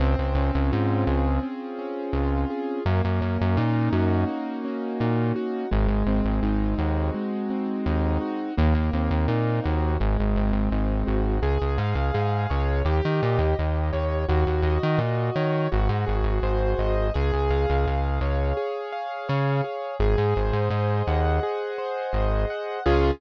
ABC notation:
X:1
M:4/4
L:1/16
Q:1/4=84
K:Db
V:1 name="Acoustic Grand Piano"
C2 D2 F2 A2 C2 D2 F2 A2 | B,2 D2 E2 G2 B,2 D2 E2 G2 | A,2 C2 E2 G2 A,2 C2 E2 G2 | B,2 C2 E2 G2 A,2 C2 E2 G2 |
A2 f2 A2 d2 =G2 e2 G2 d2 | G2 e2 G2 d2 G2 A2 c2 e2 | A2 f2 A2 d2 A2 f2 d2 A2 | A2 c2 e2 g2 A2 c2 e2 g2 |
[DFA]4 z12 |]
V:2 name="Synth Bass 1" clef=bass
D,, D,, D,, D,, A,,2 D,,6 D,,4 | G,, G,, G,, G,, B,,2 G,,6 B,,4 | A,,, A,,, A,,, A,,, A,,,2 E,,6 E,,4 | E,, E,, E,, E,, B,,2 E,,2 A,,, A,,, A,,, A,,, A,,,2 A,,,2 |
D,, D,, A,, D,, A,,2 D,,2 E,, E, B,, E,, E,,2 E,,2 | E,, E,, E,, E, B,,2 E,2 A,,, A,, A,,, A,,, A,,,2 A,,,2 | D,, D,, D,, D,, D,,2 D,,6 D,4 | A,,, A,, A,,, A,, A,,2 E,,6 A,,,4 |
D,,4 z12 |]